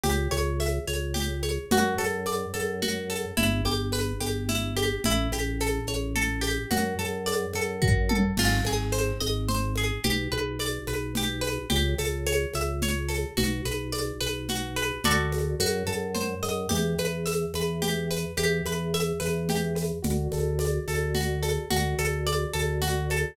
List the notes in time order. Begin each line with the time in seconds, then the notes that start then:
0.04 C#2 G4, low conga, shaker
0.31 C#2 C#5, high conga, shaker
0.60 E5, high conga, shaker
0.88 C#2 C#5, high conga, shaker
1.14 G4, low conga, shaker
1.43 C#5, high conga, shaker
1.71 F#2 F#4, low conga, shaker
1.98 F#2 A4, high conga, shaker
2.26 D5, high conga, shaker
2.54 F#2 A4, high conga, shaker
2.82 F#4, low conga, shaker
3.10 A4, high conga, shaker
3.37 G1 E4, low conga, shaker
3.65 G1 G4, high conga, shaker
3.92 B4, high conga, shaker
4.20 G1 G4, high conga, shaker
4.49 E4, low conga, shaker
4.77 G4, high conga, shaker
5.04 A1 E4, low conga, shaker
5.32 A1 G4, high conga, shaker
5.60 A4, high conga, shaker
5.87 A1 C#5, high conga, shaker
6.16 A4, low conga, shaker
6.41 G4, high conga, shaker
6.71 F#2 F#4, low conga, shaker
6.99 F#2 A4, high conga, shaker
7.26 D5, high conga, shaker
7.53 F#2 A4, high conga, shaker
7.82 F#4, kick, floor tom
8.09 A4, high tom
8.37 G#1 F4, crash, low conga, shaker
8.65 G#1 G#4, high conga, shaker
8.92 C5, high conga, shaker
9.20 G#1 D#5, high conga, shaker
9.48 C5, low conga, shaker
9.76 G#4, high conga, shaker
10.03 B1 G4, low conga, shaker
10.32 B1 B4, high conga
10.59 D5, high conga, shaker
10.87 B1 B4, high conga, shaker
11.15 G4, low conga, shaker
11.41 B4, high conga, shaker
11.70 C#2 G4, low conga, shaker
11.98 C#2 A4, high conga, shaker
12.27 C#5, high conga, shaker
12.54 C#2 E5, high conga, shaker
12.82 C#5, low conga, shaker
13.09 A4, high conga, shaker
13.37 B1 F#4, low conga, shaker
13.65 B1 B4, high conga, shaker
13.92 D5, high conga, shaker
14.21 B1 B4, high conga, shaker
14.48 F#4, low conga, shaker
14.76 B4, high conga, shaker
15.04 D2 F#4 A4 D5, low conga, shaker
15.32 high conga, shaker
15.60 F#2 F#4, high conga, shaker
15.87 F#2 A4, high conga, shaker
16.15 C5, low conga, shaker
16.43 F#2 D#5, high conga, shaker
16.69 E2 G4, low conga, shaker
16.98 E2 B4, high conga, shaker
17.26 E5, high conga, shaker
17.54 E2 B4, high conga, shaker
17.82 G4, low conga, shaker
18.11 B4, shaker
18.37 E2 G4, high conga, shaker
18.65 E2 B4, high conga, shaker
18.94 E5, high conga, shaker
19.20 E2 B4, high conga, shaker
19.49 G4, low conga, shaker
19.75 B4, high conga, shaker
20.02 D2 F#4, low conga, shaker
20.32 D2 A4, high conga, shaker
20.59 D5, high conga, shaker
20.88 D2 A4, high conga, shaker
21.15 F#4, low conga, shaker
21.43 A4, high conga, shaker
21.70 D2 F#4, low conga, shaker
21.98 D2 A4, high conga, shaker
22.27 D5, high conga, shaker
22.53 D2 A4, high conga, shaker
22.82 F#4, low conga, shaker
23.10 A4, high conga, shaker